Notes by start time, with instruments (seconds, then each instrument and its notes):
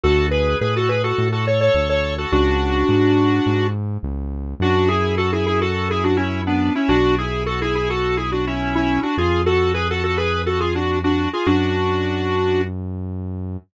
0.03 synth bass 1 D2, lead 1 (square) F#4 A4
0.31 lead 1 (square) G#4 B4
0.61 synth bass 1 A2, lead 1 (square) G#4 B4
0.76 lead 1 (square) F#4 A4
0.89 lead 1 (square) G#4 B4
1.04 lead 1 (square) F#4 A4
1.18 synth bass 1 A2
1.32 lead 1 (square) F#4 A4
1.47 lead 1 (square) A4 C#5
1.61 lead 1 (square) A4 C#5
1.75 synth bass 1 D2
1.89 lead 1 (square) A4 C#5
2.18 lead 1 (square) F#4 A4
2.32 synth bass 1 C#2, lead 1 (square) D4 F#4
2.89 synth bass 1 G#2
3.46 synth bass 1 G#2
4.03 synth bass 1 C#2
4.60 synth bass 1 F#2, lead 1 (square) D4 F#4
4.88 lead 1 (square) E4 G#4
5.17 lead 1 (square) F#4 A4
5.33 lead 1 (square) E4 G#4
5.46 lead 1 (square) E4 G#4
5.61 lead 1 (square) F#4 A4
5.90 lead 1 (square) E4 G#4
6.04 lead 1 (square) D4 F#4
6.17 lead 1 (square) C#4 E4
6.47 lead 1 (square) B3 D4
6.75 lead 1 (square) C#4 E4
6.88 synth bass 1 B1, lead 1 (square) D4 F#4
7.18 lead 1 (square) E4 G#4
7.46 lead 1 (square) F#4 A4
7.62 lead 1 (square) E4 G#4
7.75 lead 1 (square) E4 G#4
7.90 lead 1 (square) F#4 A4
8.17 lead 1 (square) E4 G#4
8.32 lead 1 (square) D4 F#4
8.47 lead 1 (square) C#4 E4
8.75 lead 1 (square) C#4 E4
9.03 lead 1 (square) D4 F#4
9.17 synth bass 1 F2, lead 1 (square) F4 G#4
9.46 lead 1 (square) F#4 A4
9.74 lead 1 (square) G#4 B4
9.90 lead 1 (square) F#4 A4
10.03 lead 1 (square) F#4 A4
10.17 lead 1 (square) G#4 B4
10.46 lead 1 (square) F#4 A4
10.60 lead 1 (square) F4 G#4
10.75 lead 1 (square) D4 F#4
11.04 lead 1 (square) D4 F#4
11.33 lead 1 (square) F4 G#4
11.46 synth bass 1 F#2, lead 1 (square) D4 F#4